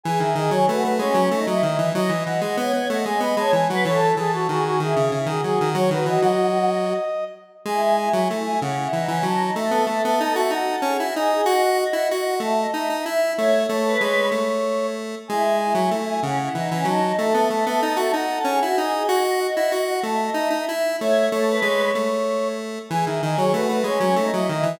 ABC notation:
X:1
M:6/8
L:1/16
Q:3/8=63
K:E
V:1 name="Brass Section"
g e d c B B c3 d d2 | d2 f f f2 f g b a g f | c A G F F F G3 G G2 | c B d d7 z2 |
g g g g z g f4 a2 | e e e e z e f4 d2 | f f f f z f a4 e2 | e2 c2 c6 z2 |
g g g g z g f4 a2 | e e e e z e f4 d2 | f f f f z f a4 e2 | e2 c2 c6 z2 |
g e d c B B c3 d d2 |]
V:2 name="Choir Aahs"
G2 G2 F2 C2 D E E2 | d d d d c c d d d c z B | A2 A2 G2 E2 E F F2 | F8 z4 |
E2 E4 C E D C D D | A2 A4 F A G F G G | d2 d4 e d e e e e | c2 A B3 z6 |
E2 E4 C E D C D D | A2 A4 F A G F G G | d2 d4 e d e e e e | c2 A B3 z6 |
G2 G2 F2 C2 D E E2 |]
V:3 name="Lead 1 (square)"
E, D, D, F, A, A, G, F, A, F, D, E, | F, E, E, G, B, B, A, G, B, G, E, F, | E,2 E,2 D,2 D, C, C, D, F, D, | F, D, E, F,5 z4 |
G,3 F, A,2 C,2 E, E, F,2 | A, B, A, B, D F D2 C E D2 | F3 E F2 A,2 D D E2 | A,2 A,2 G,2 A,6 |
G,3 F, A,2 C,2 E, E, F,2 | A, B, A, B, D F D2 C E D2 | F3 E F2 A,2 D D E2 | A,2 A,2 G,2 A,6 |
E, D, D, F, A, A, G, F, A, F, D, E, |]